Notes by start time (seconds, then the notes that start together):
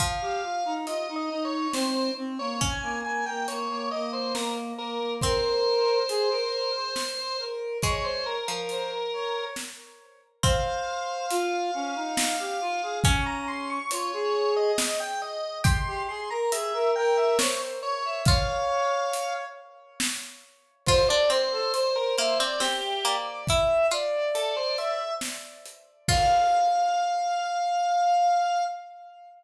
0.00 F3 F5, kick, closed hi-hat
0.22 G4
0.43 F4
0.65 D#4
0.87 F4 D#5, closed hi-hat
1.09 D#4
1.16 D#5
1.30 D#4
1.45 C#5
1.73 C4 C5, snare
2.17 C4
2.39 A#3 C#5
2.61 C#4 G#5, kick, closed hi-hat
2.83 A#3
3.04 A#3 G#5
3.26 A#3 G5
3.48 A#3 C#5, closed hi-hat
3.70 A#3
3.91 A#3 D#5
4.13 C5
4.35 A#3 A#4, snare
4.78 A#3 A#4
5.00 A#3
5.21 C4 A#4 C5, kick, closed hi-hat
6.09 G#4, closed hi-hat
6.30 A#4
6.74 C5
6.96 snare
7.17 C5
7.39 A#4
7.82 G#3 C#5, kick, closed hi-hat
8.04 C5
8.26 A#4
8.48 F3 A#4
8.69 C5, closed hi-hat
9.13 C#5
9.56 snare
10.43 C4 C5 F5, kick, closed hi-hat
11.30 F4, closed hi-hat
11.74 C#4
11.95 D#4
12.17 snare
12.39 G4
12.61 F4
12.83 G#4
13.04 C#4 C#6, kick, closed hi-hat
13.26 A#5
13.48 C6
13.70 C#6
13.91 F4 C#5, closed hi-hat
14.13 G#4
14.57 D#5
14.78 D#5, snare
15.00 G5
15.22 D#5
15.64 G4 C6, kick, closed hi-hat
15.87 G4
16.09 G#4 C6
16.30 A#4 A#5
16.52 G#4 E5, closed hi-hat
16.74 A#4
16.96 A#4 G5
17.17 E5
17.39 C5 C#5, snare
17.83 C#5
18.05 E5
18.26 F4 C#5 F5, kick, closed hi-hat
19.13 closed hi-hat
20.00 snare
20.86 F4 C5, kick, crash
21.09 D4 D5
21.30 C4 C5, closed hi-hat
21.52 A4
21.74 C5, closed hi-hat
21.96 A#4
22.17 A#3 C5 E5, closed hi-hat
22.39 C4 D5
22.60 C4 G4, snare
23.04 A#3 D5, closed hi-hat
23.47 E4 E5, kick, closed hi-hat
23.91 F4 D5, closed hi-hat
24.35 A4, closed hi-hat
24.57 C5
24.78 E5, closed hi-hat
25.21 snare
25.66 closed hi-hat
26.08 F4 F5, kick, crash